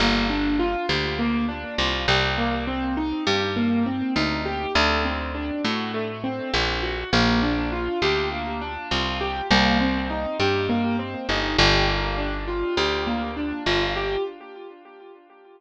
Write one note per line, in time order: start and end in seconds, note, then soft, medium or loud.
0.00 0.76 G1 medium
0.00 0.27 A#3 medium
0.30 0.56 D4 medium
0.59 0.86 F4 medium
0.89 1.65 D2 medium
0.89 1.16 G4 medium
1.19 1.46 A#3 medium
1.48 1.75 D4 medium
1.78 2.07 C2 medium
1.78 2.05 F4 medium
2.08 3.13 C2 loud
2.08 2.35 G4 medium
2.38 2.64 A#3 medium
2.67 2.94 C4 medium
2.97 3.24 D#4 medium
3.27 4.02 G2 medium
3.27 3.53 G4 medium
3.56 3.83 A#3 medium
3.86 4.13 C4 medium
4.16 4.66 D2 medium
4.16 4.43 D#4 medium
4.46 4.72 G4 medium
4.75 5.51 D2 loud
4.75 5.02 A3 medium
5.05 5.32 C4 medium
5.35 5.61 D4 medium
5.64 6.40 A2 medium
5.64 5.91 F#4 medium
5.94 6.21 A3 medium
6.24 6.50 C4 medium
6.53 7.04 A#1 medium
6.53 6.80 D4 medium
6.83 7.10 F#4 medium
7.13 7.88 A#1 medium
7.13 7.40 A#3 loud
7.43 7.69 D4 medium
7.72 7.99 F4 medium
8.02 8.78 D2 medium
8.02 8.29 G4 medium
8.32 8.58 A#3 medium
8.61 8.88 D4 medium
8.91 9.42 C2 medium
8.91 9.18 F4 medium
9.21 9.48 G4 medium
9.51 10.26 C2 loud
9.51 9.77 A#3 medium
9.80 10.07 C4 medium
10.10 10.37 D#4 medium
10.39 11.15 G2 medium
10.39 10.66 G4 medium
10.69 10.96 A#3 medium
10.99 11.26 C4 medium
11.29 11.57 G1 medium
11.29 11.55 D#4 medium
11.58 12.64 G1 loud
11.58 11.85 G4 medium
11.88 12.15 A#3 medium
12.18 12.45 D4 medium
12.48 12.74 F4 medium
12.77 13.53 D2 medium
12.77 13.04 G4 medium
13.07 13.34 A#3 medium
13.37 13.63 D4 medium
13.66 14.17 G1 medium
13.66 13.93 F4 medium
13.96 14.23 G4 medium